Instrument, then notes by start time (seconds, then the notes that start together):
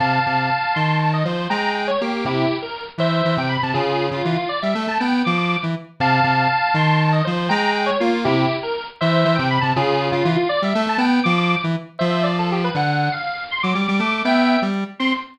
lead 1 (square)
0.00 C3 F5 A5
0.26 C3
0.74 D#3 A5 C6
1.00 A5
1.13 D#5
1.25 F3 C5
1.50 G#3 G5 A#5
1.75 G5
1.87 C#5
2.01 A#3 G4
2.25 C3 E4 G4
2.62 A#4
2.98 E3 C5 E5
3.25 E3
3.37 C3 G5
3.49 B5
3.63 C3 A5
3.74 C#3 F4 G#4
4.11 C#3 F4
4.25 E3 F4
4.36 F4
4.49 D5
4.62 G3 E5
4.75 A3
4.87 A3 A5
5.00 B3 G5
5.25 F3 D6
5.38 D6
5.63 E3
6.00 C3 F5 A5
6.24 C3
6.74 D#3 A5 C6
6.99 A5
7.12 D#5
7.25 F3 C5
7.49 G#3 G5 A#5
7.74 G5
7.86 C#5
8.00 A#3 F4
8.25 C3 E4 G4
8.63 A#4
9.01 E3 C5 E5
9.25 E3
9.35 C3 G5
9.50 B5
9.61 C3 A5
9.76 C#3 F4 G#4
10.12 C#3 F4
10.25 E3 F4
10.36 F4
10.49 D5
10.62 G3 E5
10.75 A3
10.87 A3 A5
10.98 B3 G5
11.24 F3 D6
11.38 D6
11.64 E3
11.99 F3 C5 E5
12.23 D5
12.39 A4
12.52 G4
12.64 B4
12.75 D3 F#5
13.12 F5
13.51 C6
13.63 F#3 D6
13.75 G3
13.88 G3
13.99 A3 D6
14.11 D6
14.25 B3 E5 G5
14.62 G3
14.99 C4 C6